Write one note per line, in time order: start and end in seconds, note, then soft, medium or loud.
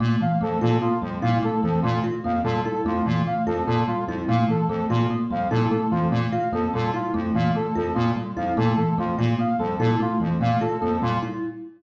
0.00 0.16 A#2 medium
0.00 0.17 A3 medium
0.20 0.37 E3 medium
0.20 0.38 F5 medium
0.41 0.58 F2 medium
0.41 0.57 A3 medium
0.41 0.59 A4 medium
0.61 0.78 A#2 medium
0.61 0.78 F4 medium
0.61 0.78 A4 medium
0.81 0.98 A#3 medium
0.81 0.98 F4 medium
1.02 1.18 F2 medium
1.02 1.18 G3 medium
1.22 1.39 A#2 medium
1.22 1.39 E4 medium
1.22 1.38 F5 medium
1.43 1.59 A3 medium
1.43 1.60 A4 medium
1.63 1.79 F2 medium
1.63 1.79 E3 medium
1.63 1.80 A4 medium
1.82 2.00 A#2 medium
1.82 2.00 A3 medium
1.82 1.99 F4 medium
2.04 2.20 F4 medium
2.24 2.41 F2 medium
2.24 2.41 A#3 medium
2.24 2.41 F5 medium
2.44 2.60 A#2 medium
2.44 2.61 G3 medium
2.44 2.60 A4 medium
2.65 2.82 E4 medium
2.65 2.82 A4 medium
2.85 3.01 F2 medium
2.85 3.02 A3 medium
2.85 3.03 F4 medium
3.06 3.22 A#2 medium
3.06 3.23 E3 medium
3.27 3.43 A3 medium
3.27 3.43 F5 medium
3.46 3.63 F2 medium
3.46 3.63 F4 medium
3.46 3.63 A4 medium
3.67 3.84 A#2 medium
3.67 3.84 A#3 medium
3.67 3.83 A4 medium
3.88 4.04 G3 medium
3.88 4.04 F4 medium
4.07 4.24 F2 medium
4.07 4.25 E4 medium
4.28 4.44 A#2 medium
4.28 4.45 A3 medium
4.28 4.44 F5 medium
4.49 4.65 E3 medium
4.49 4.66 A4 medium
4.69 4.85 F2 medium
4.69 4.86 A3 medium
4.69 4.86 A4 medium
4.90 5.06 A#2 medium
4.90 5.06 F4 medium
4.90 5.07 F4 medium
5.10 5.27 A#3 medium
5.31 5.48 F2 medium
5.31 5.47 G3 medium
5.31 5.48 F5 medium
5.50 5.67 A#2 medium
5.50 5.67 E4 medium
5.50 5.67 A4 medium
5.71 5.88 A3 medium
5.71 5.87 A4 medium
5.91 6.08 F2 medium
5.91 6.08 E3 medium
5.91 6.07 F4 medium
6.11 6.27 A#2 medium
6.11 6.29 A3 medium
6.32 6.49 F4 medium
6.32 6.48 F5 medium
6.52 6.68 F2 medium
6.52 6.69 A#3 medium
6.52 6.70 A4 medium
6.74 6.91 A#2 medium
6.74 6.90 G3 medium
6.74 6.90 A4 medium
6.94 7.10 E4 medium
6.94 7.11 F4 medium
7.14 7.31 F2 medium
7.14 7.30 A3 medium
7.35 7.51 A#2 medium
7.35 7.51 E3 medium
7.35 7.52 F5 medium
7.55 7.71 A3 medium
7.55 7.72 A4 medium
7.75 7.92 F2 medium
7.75 7.92 F4 medium
7.75 7.93 A4 medium
7.95 8.12 A#2 medium
7.95 8.12 A#3 medium
7.95 8.11 F4 medium
8.16 8.33 G3 medium
8.37 8.53 F2 medium
8.37 8.53 E4 medium
8.37 8.53 F5 medium
8.57 8.74 A#2 medium
8.57 8.73 A3 medium
8.57 8.73 A4 medium
8.77 8.94 E3 medium
8.77 8.93 A4 medium
8.98 9.14 F2 medium
8.98 9.14 A3 medium
8.98 9.15 F4 medium
9.18 9.35 A#2 medium
9.18 9.35 F4 medium
9.39 9.55 A#3 medium
9.39 9.56 F5 medium
9.59 9.76 F2 medium
9.59 9.76 G3 medium
9.59 9.75 A4 medium
9.79 9.96 A#2 medium
9.79 9.96 E4 medium
9.79 9.95 A4 medium
10.00 10.16 A3 medium
10.00 10.18 F4 medium
10.20 10.37 F2 medium
10.20 10.36 E3 medium
10.41 10.57 A#2 medium
10.41 10.57 A3 medium
10.41 10.58 F5 medium
10.61 10.77 F4 medium
10.61 10.77 A4 medium
10.80 10.99 F2 medium
10.80 10.98 A#3 medium
10.80 10.97 A4 medium
11.02 11.19 A#2 medium
11.02 11.18 G3 medium
11.02 11.19 F4 medium
11.22 11.39 E4 medium